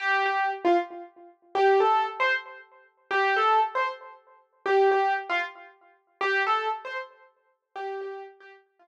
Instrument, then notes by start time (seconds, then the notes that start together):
acoustic grand piano
0.00 G4
0.26 G4
0.65 F4
1.55 G4
1.80 A4
2.20 C5
3.11 G4
3.37 A4
3.75 C5
4.66 G4
4.91 G4
5.30 F4
6.21 G4
6.47 A4
6.85 C5
7.76 G4
8.01 G4
8.40 G4
8.79 F4